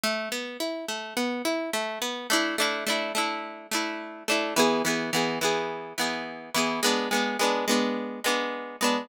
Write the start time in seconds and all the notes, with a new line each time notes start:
0.04 A3
0.32 B3
0.60 E4
0.88 A3
1.17 B3
1.45 E4
1.73 A3
2.02 B3
2.30 A3 D4 E4
2.58 A3 D4 E4
2.87 A3 D4 E4
3.15 A3 D4 E4
3.71 A3 D4 E4
4.28 A3 D4 E4
4.56 E3 B3 G#4
4.85 E3 B3 G#4
5.13 E3 B3 G#4
5.41 E3 B3 G#4
5.98 E3 B3 G#4
6.54 E3 B3 G#4
6.83 G#3 B3 D4
7.11 G#3 B3 D4
7.39 G#3 B3 D4
7.68 G#3 B3 D4
8.24 G#3 B3 D4
8.81 G#3 B3 D4